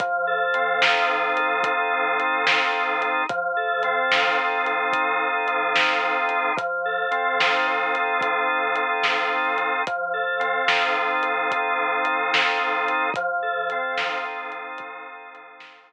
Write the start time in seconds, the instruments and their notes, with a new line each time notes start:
0.00 drawbar organ F3, kick, closed hi-hat
0.27 drawbar organ A4
0.54 drawbar organ C4, closed hi-hat
0.82 drawbar organ D#4, snare
1.11 drawbar organ F3
1.37 drawbar organ A4, closed hi-hat
1.63 drawbar organ D#4, kick, closed hi-hat
1.92 drawbar organ C4
2.18 drawbar organ F3, closed hi-hat
2.46 drawbar organ A4, snare
2.72 drawbar organ C4
3.00 drawbar organ D#4, closed hi-hat
3.29 drawbar organ F3, kick, closed hi-hat
3.57 drawbar organ A4
3.83 drawbar organ C4, closed hi-hat
4.12 drawbar organ D#4, snare
4.38 drawbar organ F3
4.66 drawbar organ A4, closed hi-hat
4.92 drawbar organ D#4, kick, closed hi-hat
5.21 drawbar organ C4
5.47 drawbar organ F3, closed hi-hat
5.74 drawbar organ A4, snare
6.03 drawbar organ C4
6.29 drawbar organ D#4, closed hi-hat
6.56 drawbar organ F3, kick, closed hi-hat
6.85 drawbar organ A4
7.11 drawbar organ C4, closed hi-hat
7.40 drawbar organ D#4, snare
7.67 drawbar organ F3
7.94 drawbar organ A4, closed hi-hat
8.21 drawbar organ D#4, kick, closed hi-hat
8.49 drawbar organ C4
8.76 drawbar organ F3, closed hi-hat
9.04 drawbar organ A4, snare
9.32 drawbar organ C4
9.58 drawbar organ D#4, closed hi-hat
9.87 drawbar organ F3, kick, closed hi-hat
10.13 drawbar organ A4
10.39 drawbar organ C4, closed hi-hat
10.68 drawbar organ D#4, snare
10.97 drawbar organ F3
11.22 drawbar organ A4, closed hi-hat
11.51 drawbar organ D#4, kick, closed hi-hat
11.79 drawbar organ C4
12.05 drawbar organ F3, closed hi-hat
12.32 drawbar organ A4, snare
12.59 drawbar organ C4
12.88 drawbar organ D#4, closed hi-hat
13.14 drawbar organ F3, kick, closed hi-hat
13.42 drawbar organ A4
13.70 drawbar organ C4, closed hi-hat
13.98 drawbar organ D#4, snare
14.25 drawbar organ F3
14.50 drawbar organ A4, closed hi-hat
14.78 drawbar organ D#4, kick, closed hi-hat
15.05 drawbar organ C4
15.34 drawbar organ F3, closed hi-hat
15.60 drawbar organ A4, snare
15.90 drawbar organ C4